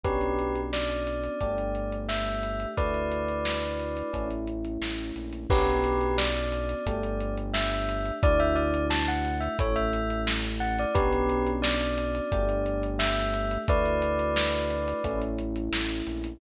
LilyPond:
<<
  \new Staff \with { instrumentName = "Tubular Bells" } { \time 4/4 \key d \major \tempo 4 = 88 <g' b'>4 d''2 e''4 | <b' d''>2~ <b' d''>8 r4. | <g' b'>4 d''2 e''4 | d''16 e''16 d''8 a''16 fis''8 e''16 cis''16 e''8. r8 fis''16 d''16 |
<g' b'>4 d''2 e''4 | <b' d''>2~ <b' d''>8 r4. | }
  \new Staff \with { instrumentName = "Electric Piano 1" } { \time 4/4 \key d \major <b cis' d' fis'>2 <a d' g'>2 | <a d' e' fis'>2 <a cis' e'>2 | <b cis' d' fis'>2 <a d' g'>2 | <a d' e' fis'>2 <a cis' e'>2 |
<b cis' d' fis'>2 <a d' g'>2 | <a d' e' fis'>2 <a cis' e'>2 | }
  \new Staff \with { instrumentName = "Synth Bass 1" } { \clef bass \time 4/4 \key d \major b,,2 g,,2 | d,2 a,,4 a,,8 ais,,8 | b,,2 g,,2 | d,2 a,,2 |
b,,2 g,,2 | d,2 a,,4 a,,8 ais,,8 | }
  \new DrumStaff \with { instrumentName = "Drums" } \drummode { \time 4/4 <hh bd>16 hh16 hh16 hh16 sn16 hh16 hh16 hh16 <hh bd>16 hh16 hh16 hh16 sn16 hh16 hh16 hh16 | <hh bd>16 hh16 hh16 hh16 sn16 hh16 hh16 hh16 <hh bd>16 hh16 hh16 hh16 sn16 hh16 hh16 hh16 | <cymc bd>16 hh16 hh16 hh16 sn16 hh16 hh16 hh16 <hh bd>16 hh16 hh16 hh16 sn16 hh16 hh16 hh16 | <hh bd>16 hh16 hh16 hh16 sn16 hh16 hh16 hh16 <hh bd>16 hh16 hh16 hh16 sn16 hh16 hh16 hh16 |
<hh bd>16 hh16 hh16 hh16 sn16 hh16 hh16 hh16 <hh bd>16 hh16 hh16 hh16 sn16 hh16 hh16 hh16 | <hh bd>16 hh16 hh16 hh16 sn16 hh16 hh16 hh16 <hh bd>16 hh16 hh16 hh16 sn16 hh16 hh16 hh16 | }
>>